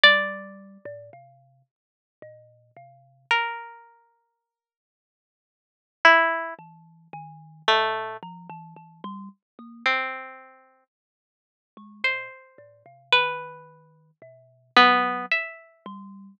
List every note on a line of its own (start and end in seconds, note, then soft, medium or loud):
0.04 0.78 G3 loud
0.04 2.98 D5 loud
0.85 1.10 A2 loud
1.13 1.62 C3 medium
2.22 2.71 A#2 medium
2.77 3.26 C3 medium
3.31 5.76 A#4 medium
6.05 6.54 E4 medium
6.59 7.08 E3 medium
7.13 7.62 D#3 loud
7.68 8.17 A#2 loud
7.68 8.17 A3 medium
8.23 8.47 F3 medium
8.50 8.74 E3 loud
8.77 9.01 E3 medium
9.04 9.29 G3 loud
9.59 9.83 A#3 medium
9.86 10.84 C4 medium
11.77 12.02 G#3 medium
12.04 12.29 A#2 medium
12.04 13.02 C5 medium
12.58 12.83 A2 medium
12.86 13.10 C3 medium
13.12 14.11 D#3 medium
13.12 14.11 B4 medium
14.22 14.71 B2 medium
14.77 15.26 F#3 loud
14.77 15.26 B3 medium
15.32 16.30 E5 medium
15.86 16.35 G3 medium